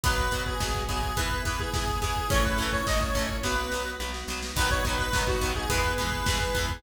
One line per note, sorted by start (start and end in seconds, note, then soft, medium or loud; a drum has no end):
0.04 0.29 B1 medium
0.04 0.15 F#3 loud
0.04 0.54 B3 medium
0.04 0.15 B3 loud
0.04 0.54 F#4 medium
0.04 0.43 B4 loud
0.04 kick loud
0.04 closed hi-hat loud
0.18 kick medium
0.31 0.55 B1 medium
0.31 0.44 F#3 medium
0.31 0.44 B3 medium
0.31 kick medium
0.31 closed hi-hat medium
0.46 0.82 G#4 medium
0.46 kick medium
0.60 0.84 B1 medium
0.60 0.72 F#3 medium
0.60 1.11 B3 medium
0.60 0.72 B3 loud
0.60 1.11 F#4 medium
0.60 kick medium
0.60 snare loud
0.75 kick medium
0.89 1.13 B1 medium
0.89 1.00 F#3 medium
0.89 1.00 B3 medium
0.89 1.16 G#4 loud
0.89 kick medium
0.89 closed hi-hat medium
1.03 kick medium
1.17 1.41 E2 medium
1.17 1.28 E3 loud
1.17 1.28 B3 loud
1.17 1.68 B3 medium
1.17 1.68 E4 medium
1.17 1.43 B4 medium
1.17 kick medium
1.17 closed hi-hat medium
1.31 kick medium
1.45 1.70 E2 medium
1.45 1.57 E3 medium
1.45 1.57 B3 loud
1.45 1.59 B4 medium
1.45 kick medium
1.45 closed hi-hat medium
1.59 1.73 G#4 medium
1.59 kick medium
1.74 1.98 E2 medium
1.74 1.85 E3 medium
1.74 1.85 B3 medium
1.74 2.26 B3 medium
1.74 2.26 E4 medium
1.74 2.00 G#4 loud
1.74 kick medium
1.74 snare loud
1.88 kick medium
2.02 2.26 E2 medium
2.02 2.13 E3 loud
2.02 2.13 B3 medium
2.02 2.30 G#4 loud
2.02 kick medium
2.02 closed hi-hat medium
2.16 kick medium
2.30 2.54 A1 medium
2.30 2.42 E3 loud
2.30 2.81 A3 medium
2.30 2.42 A3 loud
2.30 2.42 C#4 loud
2.30 2.81 C#4 medium
2.30 2.81 E4 medium
2.30 2.44 C#5 loud
2.30 kick loud
2.30 closed hi-hat medium
2.44 2.70 B4 medium
2.44 kick medium
2.57 2.81 A1 medium
2.57 2.70 A3 medium
2.57 2.70 C#4 medium
2.57 kick medium
2.57 closed hi-hat medium
2.62 2.70 E3 loud
2.73 2.86 C#5 loud
2.73 kick medium
2.87 3.11 A1 medium
2.87 2.98 E3 medium
2.87 3.38 A3 medium
2.87 2.98 A3 medium
2.87 3.38 C#4 medium
2.87 2.98 C#4 medium
2.87 3.38 E4 medium
2.87 3.00 D#5 loud
2.87 kick medium
2.87 snare loud
3.01 3.37 C#5 medium
3.01 kick medium
3.15 3.39 A1 medium
3.15 3.26 A3 loud
3.15 3.26 C#4 medium
3.15 kick medium
3.15 closed hi-hat medium
3.19 3.26 E3 medium
3.29 kick medium
3.43 3.68 B1 medium
3.43 3.55 F#3 loud
3.43 3.55 B3 loud
3.43 3.95 B3 medium
3.43 3.95 F#4 medium
3.43 3.91 B4 medium
3.43 kick medium
3.43 snare medium
3.72 3.96 B1 medium
3.72 3.83 F#3 medium
3.72 3.83 B3 medium
3.72 snare medium
4.00 4.24 B1 medium
4.00 4.11 F#3 medium
4.00 4.11 B3 medium
4.00 4.51 B3 medium
4.00 4.51 F#4 medium
4.00 snare medium
4.14 snare medium
4.28 4.52 B1 medium
4.28 4.40 F#3 medium
4.28 4.40 B3 medium
4.28 snare medium
4.42 snare medium
4.56 4.80 B1 medium
4.56 4.68 F#3 loud
4.56 4.68 B3 loud
4.56 5.08 B3 medium
4.56 5.08 D#4 medium
4.56 5.08 F#4 medium
4.56 4.70 B4 loud
4.56 kick medium
4.56 crash loud
4.60 4.68 D#3 loud
4.71 4.84 C#5 loud
4.71 kick medium
4.84 5.08 B1 medium
4.84 4.96 F#3 medium
4.84 4.96 B3 medium
4.84 4.98 B4 medium
4.84 kick medium
4.84 closed hi-hat medium
4.89 4.96 D#3 medium
4.99 5.22 B4 loud
4.99 kick medium
5.13 5.38 B1 medium
5.13 5.25 F#3 loud
5.13 5.25 B3 medium
5.13 5.65 B3 medium
5.13 5.65 D#4 medium
5.13 5.65 F#4 medium
5.13 kick medium
5.13 snare loud
5.17 5.25 D#3 medium
5.27 5.52 F#4 loud
5.27 kick medium
5.41 5.65 B1 medium
5.41 5.53 F#3 medium
5.41 5.53 B3 loud
5.41 kick medium
5.41 closed hi-hat medium
5.45 5.53 D#3 medium
5.56 5.69 G#4 loud
5.56 kick medium
5.70 5.94 E2 loud
5.70 5.81 G#3 loud
5.70 5.81 B3 loud
5.70 6.22 B3 medium
5.70 6.22 E4 medium
5.70 6.22 G#4 medium
5.70 5.94 B4 loud
5.70 kick medium
5.70 closed hi-hat loud
5.74 5.81 E3 loud
5.84 kick medium
5.98 6.23 E2 medium
5.98 6.09 E3 medium
5.98 6.09 G#3 loud
5.98 6.09 B3 medium
5.98 6.71 B4 loud
5.98 kick medium
5.98 closed hi-hat medium
6.12 kick medium
6.25 6.50 E2 medium
6.25 6.38 G#3 loud
6.25 6.77 B3 medium
6.25 6.38 B3 loud
6.25 6.77 E4 medium
6.25 6.77 G#4 medium
6.25 kick medium
6.25 snare loud
6.30 6.38 E3 medium
6.41 kick medium
6.55 6.79 E2 medium
6.55 6.66 E3 medium
6.55 6.66 G#3 loud
6.55 6.66 B3 loud
6.55 kick medium
6.55 closed hi-hat medium
6.69 kick medium